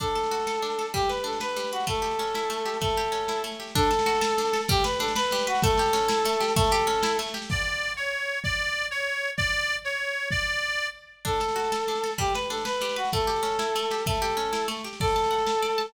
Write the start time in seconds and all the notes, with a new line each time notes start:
0.00 D4 A4, kick, snare
0.07 snare
0.15 A4, snare
0.23 snare
0.31 F#4, snare
0.40 snare
0.47 A4, snare
0.55 snare
0.62 D4, snare
0.70 snare
0.79 A4, snare
0.86 snare
0.94 G3 G4, kick, snare
1.02 snare
1.09 B4, snare
1.17 snare
1.24 D4 A4, snare
1.33 snare
1.40 B4, snare
1.49 snare
1.56 G3, snare
1.64 snare
1.72 F#4 B4, snare
1.80 snare
1.87 A3 A4, kick, snare
1.95 snare
2.02 G4, snare
2.11 snare
2.19 C#4, snare
2.27 snare
2.34 E4, snare
2.43 snare
2.50 A3, snare
2.58 snare
2.65 G4, snare
2.74 snare
2.81 A3 A4, kick, snare
2.89 snare
2.96 G4, snare
3.04 snare
3.12 C#4, snare
3.21 snare
3.28 E4, snare
3.36 snare
3.44 A3, snare
3.52 snare
3.60 G4, snare
3.68 snare
3.75 D4 A4, kick, snare
3.83 snare
3.91 A4, snare
3.99 snare
4.06 F#4, snare
4.15 snare
4.21 A4, snare
4.30 snare
4.38 D4, snare
4.45 snare
4.53 A4, snare
4.61 snare
4.68 G3 G4, kick, snare
4.76 snare
4.84 B4, snare
4.93 snare
4.99 D4 A4, snare
5.08 snare
5.15 B4, snare
5.23 snare
5.31 G3, snare
5.39 snare
5.47 F#4 B4, snare
5.55 snare
5.62 A3 A4, kick, snare
5.70 snare
5.77 G4, snare
5.86 snare
5.93 C#4, snare
6.01 snare
6.08 E4, snare
6.17 snare
6.25 A3, snare
6.33 snare
6.40 G4, snare
6.48 snare
6.56 A3 A4, kick, snare
6.64 snare
6.71 G4, snare
6.80 snare
6.87 C#4, snare
6.95 snare
7.03 E4, snare
7.11 snare
7.19 A3, snare
7.26 snare
7.34 G4, snare
7.42 snare
7.49 D5, kick, crash
7.97 C#5
8.44 D5, kick
8.91 C#5
9.37 D5, kick
9.85 C#5
10.31 D5, kick
11.25 D4 A4, kick, snare
11.33 snare
11.40 A4, snare
11.48 snare
11.56 F#4, snare
11.64 snare
11.72 A4, snare
11.80 snare
11.87 D4, snare
11.95 snare
12.04 A4, snare
12.11 snare
12.18 G3 G4, kick, snare
12.26 snare
12.34 B4, snare
12.42 snare
12.50 D4 A4, snare
12.57 snare
12.65 B4, snare
12.73 snare
12.81 G3, snare
12.89 snare
12.96 F#4 B4, snare
13.05 snare
13.12 A3 A4, kick, snare
13.20 snare
13.27 G4, snare
13.36 snare
13.43 C#4, snare
13.52 snare
13.59 E4, snare
13.67 snare
13.75 A3, snare
13.83 snare
13.91 G4, snare
13.98 snare
14.06 A3 A4, kick, snare
14.14 snare
14.22 G4, snare
14.30 snare
14.37 C#4, snare
14.45 snare
14.53 E4, snare
14.61 snare
14.68 A3, snare
14.77 snare
14.84 G4, snare
14.93 snare
15.00 A4 D5, kick, snare, crash
15.07 snare
15.16 A5, snare
15.24 snare
15.31 F#5, snare
15.38 snare
15.47 A5, snare
15.55 snare
15.62 D5, snare
15.70 snare
15.78 A5, snare
15.86 snare